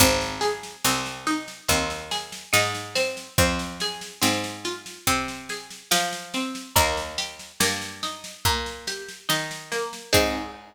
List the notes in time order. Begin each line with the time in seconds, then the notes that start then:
0.00 G#1 C4, kick, snare
0.21 snare
0.41 G#4, snare
0.63 snare
0.85 C2 C4, snare
1.06 snare
1.27 D#4, snare
1.48 snare
1.68 D#2 C4, kick, snare
1.90 snare
2.11 G#4, snare
2.32 snare
2.53 G#2 D#4, snare
2.75 snare
2.95 C4, snare
3.17 snare
3.38 F2 C4, kick, snare
3.59 snare
3.80 G#4, snare
4.01 snare
4.21 G#2 C4, snare
4.44 snare
4.65 F4, snare
4.86 snare
5.07 C3 C4, kick, snare
5.28 snare
5.49 G#4, snare
5.70 snare
5.91 F3 F4, snare
6.13 snare
6.34 C4, snare
6.55 snare
6.76 D#2 A#3, kick, snare
6.97 snare
7.18 G4, snare
7.39 snare
7.60 G2 A#3, snare
7.82 snare
8.03 D#4, snare
8.24 snare
8.45 A#2 A#3, kick, snare
8.66 snare
8.87 G4, snare
9.08 snare
9.29 D#3 D#4, snare
9.51 snare
9.72 A#3, snare
9.93 snare
10.13 G#2 C4 D#4 G#4, kick, crash